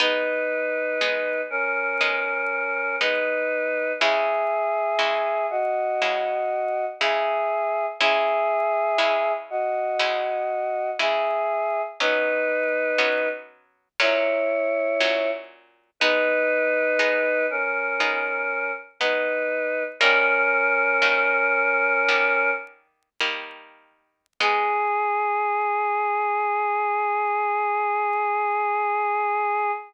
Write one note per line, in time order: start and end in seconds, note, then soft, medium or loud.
0.00 0.90 G#3 medium
0.00 0.90 B3 loud
0.00 0.90 D#4 loud
0.00 1.41 D#4 medium
0.00 1.41 B4 medium
1.01 1.91 G#3 medium
1.01 1.91 B3 medium
1.01 1.91 D#4 medium
1.50 2.96 C#4 medium
1.50 2.96 A#4 medium
2.01 2.91 G#3 medium
2.01 2.91 B3 medium
2.01 2.91 D#4 medium
3.00 3.91 G#3 medium
3.00 3.91 B3 medium
3.00 3.92 D#4 medium
3.00 3.91 D#4 medium
3.00 3.92 B4 medium
4.00 4.91 C#3 medium
4.00 4.91 G#3 loud
4.00 4.91 E4 loud
4.00 5.46 G#4 medium
4.00 5.46 E5 medium
4.99 5.89 C#3 medium
4.99 5.89 G#3 medium
4.99 5.89 E4 medium
5.50 6.85 F#4 medium
5.50 6.85 D#5 medium
6.02 6.92 C#3 medium
6.02 6.92 G#3 medium
6.02 6.92 E4 medium
7.00 7.91 C#3 loud
7.00 7.91 G#3 medium
7.00 7.91 E4 medium
7.00 7.86 G#4 medium
7.00 7.86 E5 medium
8.00 8.90 C#3 loud
8.00 8.90 G#3 medium
8.00 8.90 E4 loud
8.00 9.32 G#4 medium
8.00 9.32 E5 medium
8.98 9.88 C#3 medium
8.98 9.88 G#3 medium
8.98 9.88 E4 loud
9.50 10.90 F#4 medium
9.50 10.90 D#5 medium
9.99 10.89 C#3 medium
9.99 10.89 G#3 loud
9.99 10.89 E4 medium
10.99 11.89 C#3 medium
10.99 11.89 G#3 medium
10.99 11.89 E4 medium
10.99 11.82 G#4 medium
10.99 11.82 E5 medium
12.00 12.90 F#3 medium
12.00 12.90 B3 medium
12.00 12.90 C#4 medium
12.00 13.29 D#4 medium
12.00 13.29 B4 medium
12.98 13.88 F#3 medium
12.98 13.88 B3 medium
12.98 13.88 C#4 medium
14.00 14.90 A#2 medium
14.00 14.90 F#3 loud
14.00 14.90 C#4 loud
14.00 15.30 E4 medium
14.00 15.30 C#5 medium
15.00 15.90 A#2 medium
15.00 15.90 F#3 medium
15.00 15.90 C#4 medium
16.00 16.91 G#3 loud
16.00 16.91 B3 loud
16.00 17.46 D#4 medium
16.00 16.91 D#4 loud
16.00 17.46 B4 medium
16.99 17.89 G#3 medium
16.99 17.89 B3 medium
16.99 17.89 D#4 medium
17.50 18.71 C#4 medium
17.50 18.71 A#4 medium
18.00 18.90 G#3 medium
18.00 18.90 B3 medium
18.00 18.90 D#4 medium
19.00 19.91 G#3 medium
19.00 19.91 B3 medium
19.00 19.83 D#4 medium
19.00 19.91 D#4 medium
19.00 19.83 B4 medium
20.00 20.92 D#3 loud
20.00 20.92 G3 loud
20.00 20.92 A#3 loud
20.00 22.51 C#4 medium
20.00 22.51 A#4 medium
21.02 21.98 D#3 medium
21.02 21.98 G3 medium
21.02 21.98 A#3 medium
22.09 23.09 D#3 medium
22.09 23.09 G3 medium
22.09 23.09 A#3 medium
23.21 24.27 D#3 medium
23.21 24.27 G3 medium
23.21 24.27 A#3 medium
24.40 29.72 G#3 loud
24.40 29.72 B3 loud
24.40 29.72 D#4 medium
24.40 29.71 G#4 loud